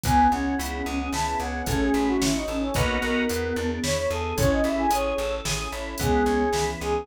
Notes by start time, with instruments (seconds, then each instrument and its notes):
0.03 electric bass (finger) C#2, drawbar organ B3, pad 2 (warm) B3 C#4 E4 G#4, flute B3, brass section G#5, kick, closed hi-hat
0.32 electric bass (finger) C#2, flute C#4, drawbar organ C#4, brass section F#5
0.59 electric bass (finger) C#2, drawbar organ E4, closed hi-hat
0.73 flute C#4
0.86 electric bass (finger) C#2, pad 2 (warm) B3 C#4 G#4 B4, flute C#4, drawbar organ G#4
1.00 flute C#4
1.13 electric bass (finger) C#2, drawbar organ E4, brass section A5, snare
1.27 brass section A5
1.40 electric bass (finger) C#2, drawbar organ C#4, brass section F#5
1.66 electric bass (finger) A1, flute A3 C#4, drawbar organ C#4, pad 2 (warm) C#4 E4 F#4 A4, brass section A4, kick, closed hi-hat
1.81 brass section G#4
1.94 electric bass (finger) A1, drawbar organ E4
2.08 brass section F#4
2.21 electric bass (finger) A1, pad 2 (warm) C#4 E4 A4 C#5, brass section E4, drawbar organ F#4, snare
2.34 brass section D#4
2.48 electric bass (finger) A1, flute C#4, drawbar organ A4
2.62 brass section C#4
2.74 electric bass (finger) B1, flute A#3, pad 2 (warm) B3 D#4 F#4 A#4, drawbar organ B3 D#4 F#4 A#4, brass section B4, kick, closed hi-hat
3.02 electric bass (finger) B1, flute B3, brass section A#4
3.29 electric bass (finger) E2, pad 2 (warm) B3 D4 E4 G#4, drawbar organ B3, closed hi-hat
3.43 flute B3
3.56 electric bass (finger) E2, flute B3, drawbar organ D4
3.70 flute B3
3.83 electric bass (finger) E2, pad 2 (warm) B3 D4 G#4 B4, drawbar organ E4, brass section C#5, snare
3.97 brass section C#5
4.10 electric bass (finger) E2, drawbar organ G#4, brass section A4
4.37 electric bass (finger) A1, drawbar organ C#4, pad 2 (warm) C#4 E4 G#4 A4, flute C#4 E4, brass section C#5, kick, closed hi-hat
4.51 brass section D#5
4.64 electric bass (finger) A1, drawbar organ E4, brass section E5
4.78 brass section G#5
4.91 electric bass (finger) A1, drawbar organ G#4, brass section C#5, closed hi-hat
5.18 electric bass (finger) A1, pad 2 (warm) C#4 E4 A4 C#5, drawbar organ A4
5.45 electric bass (finger) A1, drawbar organ G#4, snare
5.72 electric bass (finger) A1, drawbar organ E4
5.98 electric bass (finger) C#2, flute G#3 B3, drawbar organ B3, pad 2 (warm) B3 C#4 E4 G#4, brass section G#4, kick, closed hi-hat
6.26 electric bass (finger) C#2, drawbar organ C#4
6.53 electric bass (finger) C#2, flute E3, pad 2 (warm) B3 C#4 G#4 B4, drawbar organ E4, snare
6.81 electric bass (finger) C#2, drawbar organ G#4, brass section G#4